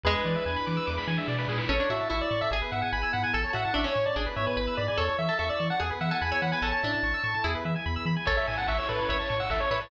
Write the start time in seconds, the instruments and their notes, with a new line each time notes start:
0.04 synth bass 1 E2, harpsichord G#3, pad 2 (warm) D4 E4 G#4 B4, lead 1 (square) G#4 B4, kick, snare
0.15 lead 1 (square) B4
0.25 synth bass 1 E3, lead 1 (square) D5, snare
0.36 lead 1 (square) E5
0.46 synth bass 1 E2, lead 1 (square) G#5, snare
0.56 lead 1 (square) B5
0.67 synth bass 1 E3, lead 1 (square) D6, snare
0.77 lead 1 (square) E6
0.87 synth bass 1 E2, lead 1 (square) D6, snare
0.98 lead 1 (square) B5, snare
1.08 synth bass 1 E3, lead 1 (square) G#5, snare
1.17 lead 1 (square) E5, snare
1.28 synth bass 1 B2, lead 1 (square) D5, snare
1.38 lead 1 (square) B4, snare
1.48 synth bass 1 A#2, lead 1 (square) G#4, snare
1.58 lead 1 (square) B4, snare
1.69 synth bass 1 A1, harpsichord C#4, pad 2 (warm) C#4 E4 A4, lead 1 (square) A4 C#5
1.80 harpsichord D4, lead 1 (square) C#5
1.90 synth bass 1 A2, harpsichord F#4, lead 1 (square) E5
2.00 lead 1 (square) A5
2.10 synth bass 1 A1, harpsichord E4, lead 1 (square) E5 C#6
2.21 lead 1 (square) D5 E6
2.31 synth bass 1 A2, lead 1 (square) C#6
2.41 lead 1 (square) E5 A5
2.51 synth bass 1 G#1, pad 2 (warm) B3 E4 G#4, lead 1 (square) G#4, harpsichord G#4
2.62 lead 1 (square) B4
2.72 synth bass 1 G#2, lead 1 (square) E5 F#5
2.82 lead 1 (square) F#5 G#5
2.92 synth bass 1 G#1, lead 1 (square) G#5 B5
3.03 lead 1 (square) E6
3.13 synth bass 1 G#2, lead 1 (square) F#5 B5
3.23 lead 1 (square) G#5
3.33 synth bass 1 A1, pad 2 (warm) C#4 E4 A4, lead 1 (square) A4 A5, harpsichord A4
3.44 lead 1 (square) C#5
3.53 synth bass 1 A2, harpsichord F#4, lead 1 (square) E5 F#5
3.65 lead 1 (square) A5
3.74 synth bass 1 A1, harpsichord D4, lead 1 (square) E5 C#6
3.84 harpsichord C#4, lead 1 (square) C#5 E6
3.95 synth bass 1 A2, lead 1 (square) C#6
4.06 lead 1 (square) D5 A5
4.16 synth bass 1 G#1, pad 2 (warm) B3 E4 G#4, harpsichord D4, lead 1 (square) G#4
4.26 lead 1 (square) B4
4.36 synth bass 1 G#2, lead 1 (square) C#5 E5
4.46 lead 1 (square) B4 G#5
4.57 synth bass 1 G#1, lead 1 (square) B4 B5, harpsichord B4
4.67 lead 1 (square) E6
4.77 synth bass 1 G#2, lead 1 (square) D5 B5
4.88 lead 1 (square) D5 G#5
4.97 synth bass 1 E2, pad 2 (warm) C#4 E4 A4, harpsichord A4, lead 1 (square) A4 C#5
5.08 lead 1 (square) C#5
5.19 synth bass 1 E3, lead 1 (square) E5
5.29 harpsichord A4, lead 1 (square) A5
5.39 synth bass 1 E2, harpsichord A4, lead 1 (square) E5 C#6
5.49 lead 1 (square) D5 E6
5.60 synth bass 1 E3, lead 1 (square) C#6
5.70 lead 1 (square) F#5 A5
5.80 synth bass 1 E2, pad 2 (warm) B3 E4 G#4, harpsichord G#4, lead 1 (square) G#4
5.90 lead 1 (square) B4
6.01 synth bass 1 E3, lead 1 (square) E5 F#5
6.11 harpsichord A4, lead 1 (square) F#5 G#5
6.22 synth bass 1 E2, lead 1 (square) G#5 B5
6.32 harpsichord C#5, lead 1 (square) E6
6.42 synth bass 1 E3, lead 1 (square) F#5 B5
6.52 harpsichord B4, lead 1 (square) G#5
6.62 synth bass 1 A1, harpsichord C#4, pad 2 (warm) C#4 E4 A4, lead 1 (square) A4 A5
6.73 lead 1 (square) C#5
6.83 synth bass 1 A2, harpsichord D4, lead 1 (square) E5
6.93 lead 1 (square) A5
7.03 synth bass 1 A1, lead 1 (square) C#6
7.14 lead 1 (square) E6
7.24 synth bass 1 A2, lead 1 (square) C#6
7.34 lead 1 (square) A5
7.44 synth bass 1 E2, pad 2 (warm) B3 E4 G#4, harpsichord E4, lead 1 (square) G#4
7.55 lead 1 (square) B4
7.65 synth bass 1 E3, lead 1 (square) E5
7.76 lead 1 (square) G#5
7.86 synth bass 1 E2, lead 1 (square) B5
7.96 lead 1 (square) E6
8.06 synth bass 1 E3, lead 1 (square) B5
8.17 lead 1 (square) G#5
8.25 synth bass 1 A1, pad 2 (warm) C#4 E4 A4, lead 1 (square) A4 C#5, harpsichord A4, kick, crash
8.37 lead 1 (square) C#5 E5
8.47 synth bass 1 A2, lead 1 (square) E5 G#5, open hi-hat
8.58 lead 1 (square) F#5 A5
8.67 synth bass 1 A1, lead 1 (square) E5 C#6, kick, clap
8.78 lead 1 (square) C#5 E6
8.88 synth bass 1 A2, lead 1 (square) A4 B4, open hi-hat
8.99 lead 1 (square) C#5
9.08 synth bass 1 A1, lead 1 (square) C#5 E5, harpsichord C#5, kick, closed hi-hat
9.19 lead 1 (square) C#5 A5
9.30 synth bass 1 A2, lead 1 (square) C#6, open hi-hat
9.40 lead 1 (square) F#5 E6
9.50 synth bass 1 A1, lead 1 (square) A4 E5, kick, clap
9.60 lead 1 (square) C#5
9.71 synth bass 1 A2, lead 1 (square) B4 E5, harpsichord C#5, open hi-hat
9.81 lead 1 (square) C#5 A5